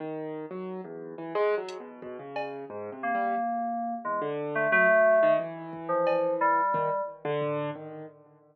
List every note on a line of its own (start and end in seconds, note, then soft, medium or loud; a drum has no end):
0.00 0.46 D#3 medium
0.51 0.81 F#3 medium
0.84 1.15 E2 medium
1.18 1.33 E3 medium
1.35 1.55 G#3 loud
1.57 1.78 F#3 medium
1.69 closed hi-hat medium
1.80 2.00 B2 medium
2.02 2.17 B2 medium
2.02 kick medium
2.19 2.65 C#3 medium
2.36 cowbell medium
2.70 2.90 G#2 medium
2.92 3.12 C3 medium
3.03 3.94 A#3 medium
3.15 3.35 G3 medium
4.04 4.20 E2 medium
4.04 4.20 G#3 soft
4.21 4.67 D3 medium
4.55 4.71 A3 medium
4.72 4.87 F#3 medium
4.72 5.33 A3 loud
4.89 5.19 F#3 medium
5.22 5.38 D#3 loud
5.39 6.61 E3 medium
5.73 kick medium
5.89 6.34 F3 medium
6.07 cowbell medium
6.41 7.01 G3 medium
6.74 6.89 D#3 medium
6.74 kick medium
7.25 7.70 D3 loud
7.42 floor tom medium
7.75 8.06 D#3 soft